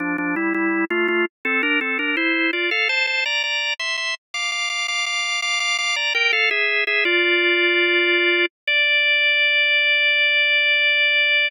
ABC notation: X:1
M:4/4
L:1/16
Q:1/4=83
K:Dm
V:1 name="Drawbar Organ"
[F,D] [F,D] [G,E] [G,E]2 [A,F] [A,F] z [CA] [DB] [CA] [DB] [Ec]2 [Fd] [Af] | [ca] [ca] [db] [db]2 [ec'] [ec'] z [fd'] [fd'] [fd'] [fd'] [fd']2 [fd'] [fd'] | [fd'] [db] [Bg] [Af] [^Ge]2 [Ge] [Fd]9 | d16 |]